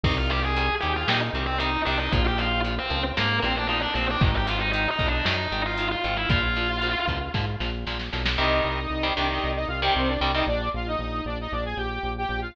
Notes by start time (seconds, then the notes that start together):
0.03 C2 C3 D#3 G3 D#4 D#5, kick, crash
0.17 F4 F5
0.30 C3 D#3 G3 G4 G5, closed hi-hat
0.42 G#4 G#5
0.56 C3 D#3 G3, closed hi-hat
0.80 D#2 C3 D#3 G3 G4 G5, closed hi-hat
0.96 F4 F5
1.08 A#2 C3 D#3 G3 D#4 D#5, snare
1.33 C2 C3 D#3 G3, closed hi-hat
1.46 C4 C5
1.59 C3 D#3 G3 D#4 D#5, closed hi-hat
1.85 C2 C3 D#3 G3 D4 D5, open hi-hat
1.99 D#4 D#5
2.12 A#1 A#2 F3 F4 F5, kick, closed hi-hat
2.27 G4 G5
2.38 A#2 F3 F4 F5, closed hi-hat
2.64 A#2 F3, closed hi-hat
2.78 C4 C5
2.90 C#2 A#2 F3, closed hi-hat
3.17 G#2 A#2 F3 A#3 A#4, snare
3.42 A#1 A#2 F3 C4 C5, closed hi-hat
3.56 D4 D5
3.67 A#2 F3 D#4 D#5
3.82 D4 D5
3.94 A#1 A#2 F3 C4 C5, open hi-hat
4.10 D4 D5
4.21 G#1 G#2 D#3 D#4 D#5, kick
4.36 G4 G5
4.47 G#2 D#3 F4 F5, closed hi-hat
4.59 D#4 D#5
4.72 G#2 D#3 D#4 D#5, closed hi-hat
4.90 D#4 D#5
4.99 B1 G#2 D#3, kick, closed hi-hat
5.08 D4 D5
5.25 F#2 G#2 D#3 D#4 D#5, snare
5.51 G#1 G#2 D#3, closed hi-hat
5.66 F4 F5
5.77 G#2 D#3, closed hi-hat
5.91 F4 F5
6.04 G#1 G#2 D#3, closed hi-hat
6.17 E4 E5
6.29 A#1 A#2 F3 F4 F5, kick, closed hi-hat
6.56 A#2 F3, closed hi-hat
6.82 A#2 F3, closed hi-hat
7.07 C#2 A#2 F3, kick, closed hi-hat
7.34 G#2 A#2 F3, kick, snare
7.60 A#1 A#2 F3, snare
7.86 A#1 A#2 F3, snare
7.99 snare
8.12 B1 A#2 F3, snare
8.25 snare
8.38 C2 C3 D#3 G3 D#4 D#5
8.65 C2
8.90 C2
9.03 C3 D#3 G3
9.15 C2 C3 D#3 G3 D4 D5
9.30 D#4 D#5
9.44 C2
9.56 D#4 D#5
9.68 C2 F4 F5
9.82 C3 D#3 G3 G4 G5
9.96 C2 C4 C5
10.07 D4 D5
10.20 C2 C3 D#3 G3 D4 D5
10.34 C3 D#3 G3 D#4 D#5
10.47 A#1 D4 D5
10.74 A#1 F4 F5
10.87 D#4 D#5
10.99 A#1
11.25 A#1 D4 D5
11.41 D#4 D#5
11.52 A#1 D4 D5
11.65 G#4 G#5
11.77 A#1 G4 G5
12.03 A#1
12.18 G4 G5
12.29 A#1
12.41 F4 F5